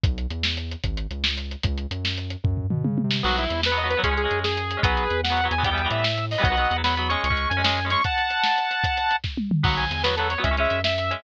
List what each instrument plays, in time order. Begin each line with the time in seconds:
0.04 synth bass 1 B1, kick, closed hi-hat
0.18 closed hi-hat
0.30 synth bass 1 E2, closed hi-hat
0.43 snare
0.57 closed hi-hat
0.71 closed hi-hat
0.84 synth bass 1 G#1, kick, closed hi-hat
0.97 closed hi-hat
1.11 synth bass 1 C#2, closed hi-hat
1.24 snare
1.38 closed hi-hat
1.51 closed hi-hat
1.63 synth bass 1 C#2, kick, closed hi-hat
1.78 closed hi-hat
1.91 synth bass 1 F#2, closed hi-hat
2.05 snare
2.18 closed hi-hat
2.30 closed hi-hat
2.44 synth bass 1 F#2, kick, floor tom
2.57 floor tom
2.70 synth bass 1 B2, mid tom
2.84 synth bass 1 C#3, high tom
2.98 high tom
3.04 synth bass 1 C3
3.11 snare
3.23 synth bass 1 B1, overdriven guitar F#3 B3, lead 2 (sawtooth) F#4, crash
3.38 lead 2 (sawtooth) E4, closed hi-hat
3.50 synth bass 1 E2, closed hi-hat
3.63 lead 2 (sawtooth) B4, snare
3.72 overdriven guitar F#3 B3
3.77 lead 2 (sawtooth) D#5, closed hi-hat
3.84 overdriven guitar F#3 B3
3.90 lead 2 (sawtooth) B4, closed hi-hat
3.97 overdriven guitar F#3 B3
4.04 synth bass 1 C#2, overdriven guitar G#3 C#4, lead 2 (sawtooth) G#4, kick, closed hi-hat
4.11 overdriven guitar G#3 C#4
4.17 lead 2 (sawtooth) G#4, closed hi-hat
4.24 overdriven guitar G#3 C#4
4.31 synth bass 1 F#2, closed hi-hat
4.44 lead 2 (sawtooth) G#4, snare
4.57 closed hi-hat
4.71 closed hi-hat
4.77 overdriven guitar G#3 C#4
4.83 synth bass 1 B1, overdriven guitar F#3 B3, lead 2 (sawtooth) G#4 B4, kick, closed hi-hat
4.97 closed hi-hat
5.10 synth bass 1 E2, closed hi-hat
5.23 lead 2 (sawtooth) F#5, snare
5.30 overdriven guitar F#3 B3
5.37 closed hi-hat
5.44 overdriven guitar F#3 B3
5.51 synth bass 1 E2, lead 2 (sawtooth) G#5, closed hi-hat
5.58 overdriven guitar F#3 B3
5.64 overdriven guitar E3 G3 B3, lead 2 (sawtooth) G5, kick, closed hi-hat
5.71 overdriven guitar E3 G3 B3
5.78 closed hi-hat
5.83 overdriven guitar E3 G3 B3
5.91 synth bass 1 A2, lead 2 (sawtooth) E5, closed hi-hat
6.04 snare
6.18 closed hi-hat
6.31 lead 2 (sawtooth) D#5, open hi-hat
6.38 overdriven guitar E3 G3 B3
6.43 synth bass 1 B1, overdriven guitar F#3 B3, lead 2 (sawtooth) D#5 F#5, kick, closed hi-hat
6.50 overdriven guitar F#3 B3
6.57 overdriven guitar F#3 B3, closed hi-hat
6.71 synth bass 1 E2, closed hi-hat
6.76 overdriven guitar F#3 B3
6.84 overdriven guitar F#3 B3, lead 2 (sawtooth) B5, snare
6.97 overdriven guitar F#3 B3, closed hi-hat
7.09 overdriven guitar G#3 C#4, lead 2 (sawtooth) C#6, closed hi-hat
7.24 synth bass 1 C#2, lead 2 (sawtooth) C#6, closed hi-hat
7.30 overdriven guitar G#3 C#4, kick
7.37 closed hi-hat
7.49 synth bass 1 F#2, lead 2 (sawtooth) G#5, closed hi-hat
7.57 overdriven guitar G#3 C#4
7.64 overdriven guitar G#3 C#4, snare
7.77 closed hi-hat
7.85 overdriven guitar G#3 C#4
7.90 overdriven guitar G#3 C#4, lead 2 (sawtooth) C#6, closed hi-hat
8.04 lead 2 (sawtooth) F#5 A5, kick, closed hi-hat
8.18 closed hi-hat
8.30 closed hi-hat
8.44 snare
8.58 closed hi-hat
8.71 closed hi-hat
8.84 kick, closed hi-hat
8.97 closed hi-hat
9.11 closed hi-hat
9.24 kick, snare
9.37 high tom
9.51 mid tom
9.63 synth bass 1 B1, overdriven guitar F#3 B3, lead 2 (sawtooth) F#5, kick, crash
9.77 lead 2 (sawtooth) G#5, closed hi-hat
9.91 synth bass 1 E2, closed hi-hat
10.03 overdriven guitar F#3 B3, lead 2 (sawtooth) B4, snare
10.16 overdriven guitar F#3 B3, lead 2 (sawtooth) A4, closed hi-hat
10.30 lead 2 (sawtooth) C#5, closed hi-hat
10.38 overdriven guitar F#3 B3
10.43 synth bass 1 C#2, overdriven guitar G#3 C#4, lead 2 (sawtooth) E5, kick, closed hi-hat
10.51 overdriven guitar G#3 C#4
10.57 overdriven guitar G#3 C#4, lead 2 (sawtooth) E5, closed hi-hat
10.70 synth bass 1 F#2, closed hi-hat
10.84 lead 2 (sawtooth) E5, snare
10.98 closed hi-hat
11.11 overdriven guitar G#3 C#4, closed hi-hat